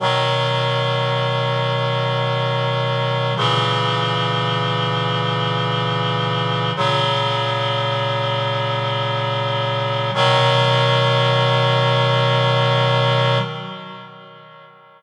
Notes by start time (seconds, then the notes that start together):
0.00 B2 D#3 F#3
3.37 A#2 C#3 E3
6.76 A#2 C#3 F#3
10.14 B2 D#3 F#3